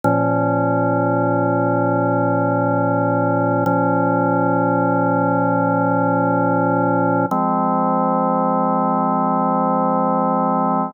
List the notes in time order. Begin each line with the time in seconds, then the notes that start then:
0.04 A#2 F3 C#4
3.66 A#2 F3 C#4
7.31 F3 G#3 C4